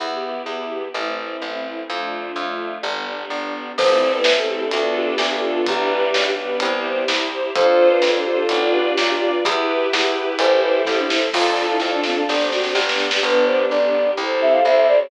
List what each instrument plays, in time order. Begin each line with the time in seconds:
0.00 electric bass (finger) E2, string ensemble 1 B3 E4 G4
0.46 electric bass (finger) E2
0.94 electric bass (finger) A1, string ensemble 1 A3 C4 E4
1.42 electric bass (finger) A1
1.89 electric bass (finger) F2, string ensemble 1 A3 D4 F4
2.36 electric bass (finger) F2
2.83 electric bass (finger) G1, string ensemble 1 G3 B3 D4
3.30 electric bass (finger) G1
3.77 electric bass (finger) A1, violin F3 A3, string ensemble 1 C4 E4 A4, flute C5, kick, crash
3.93 violin E3 G3
4.10 violin G3 B3, flute B4
4.24 electric bass (finger) A1, string ensemble 1 C4 E4 A4, snare
4.38 violin A3 C4, flute A4
4.48 violin A3 C4, flute G4
4.61 violin B3 D4, flute A4
4.71 electric bass (finger) D2, violin B3 D4, string ensemble 1 D4 F4 A4, closed hi-hat
4.96 flute G4
5.18 electric bass (finger) D2, string ensemble 1 D4 F4 A4, snare
5.30 flute G4
5.43 violin B3 D4
5.55 flute F4
5.67 electric bass (finger) B1, violin E3 G3, string ensemble 1 D4 G4 B4, flute G4, kick, closed hi-hat
6.14 electric bass (finger) B1, string ensemble 1 D4 G4 B4, snare
6.38 violin G3 B3
6.60 electric bass (finger) C2, string ensemble 1 E4 G4 C5, closed hi-hat
7.08 electric bass (finger) C2, string ensemble 1 E4 G4 C5, snare
7.56 electric bass (finger) F2, violin D4 F4, string ensemble 1 F4 A4 C5, flute C5, kick, closed hi-hat
7.90 flute B4
8.02 electric bass (finger) F2, string ensemble 1 F4 A4 C5, snare
8.16 flute A4
8.25 flute G4
8.39 flute A4
8.49 electric bass (finger) B1, string ensemble 1 F4 B4 D5, closed hi-hat
8.74 flute G4
8.98 electric bass (finger) B1, string ensemble 1 F4 B4 D5, snare
9.10 flute G4
9.32 flute F4
9.44 electric bass (finger) E2, violin E4 G4, string ensemble 1 E4 G4 B4, flute G4, kick, closed hi-hat
9.92 electric bass (finger) E2, string ensemble 1 E4 G4 B4, flute E4, snare
10.39 electric bass (finger) A1, string ensemble 1 E4 A4 C5, flute C5, closed hi-hat
10.63 flute B4
10.85 electric bass (finger) A1, string ensemble 1 E4 A4 C5, flute A4, kick, snare
10.98 flute D4
11.10 flute E4, snare
11.33 electric bass (finger) F2, string ensemble 1 D4 F4 A4 D5 F5 A5, flute F4, violin F4 A4, kick, snare, crash
11.57 violin F4 A4, snare
11.70 flute E4
11.80 electric bass (finger) F2, string ensemble 1 D4 F4 A4, snare
11.94 flute D4
12.03 flute C4, snare
12.16 flute D4
12.28 electric bass (finger) G1, string ensemble 1 C4 D4 G4 C5 D5 G5, snare
12.41 snare
12.52 flute F#4, snare
12.63 snare
12.74 electric bass (finger) G1, string ensemble 1 B3 D4 G4 B4 D5 G5, flute G4, snare
12.89 snare
12.98 snare
13.11 snare
13.23 electric bass (finger) G1, string ensemble 1 B3 D4 G4, violin B3 D4, flute B4
13.46 flute C5
13.69 electric bass (finger) G1, string ensemble 1 G3 B3 D4 G4, flute D5
14.17 electric bass (finger) C2, string ensemble 1 C4 E4 G4, violin A4 C5
14.42 flute E5
14.52 flute F5
14.65 electric bass (finger) C2, string ensemble 1 C4 E4 G4 C5, flute E5
14.76 flute E5
14.88 flute D5
15.01 flute C#5